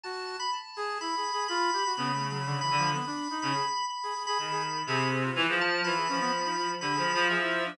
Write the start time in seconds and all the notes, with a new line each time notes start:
0.03 F#4 A5
0.40 B5
0.53 A5
0.76 G#4
1.01 E4 B5
1.17 G#4
1.33 G#4
1.48 F4 B5
1.73 G4
1.85 F#4
1.97 C#3 B3 B5
2.13 A3
2.30 F#3 B5
2.46 D3
2.61 E3 B5
2.71 D3
2.78 F3
2.94 B3 B5
3.06 D4
3.30 D#4
3.42 C#3 B5
3.55 G#4
3.90 B5
4.03 G#4
4.15 G#4
4.27 G#4 B5
4.39 D#3 G#4 B5
4.51 G#4
4.86 C3 G#4 B5
5.12 G#4
5.24 F4
5.35 E3
5.48 F3 G#4
5.61 A5
5.84 E3 F4 B5
5.96 G#4
6.09 F3 C#4
6.21 B3
6.45 D#4
6.57 F4
6.81 D3 G4 B5
6.93 G#4
6.97 F3
7.14 F3
7.29 F3 G#4 E5
7.42 E4
7.66 D4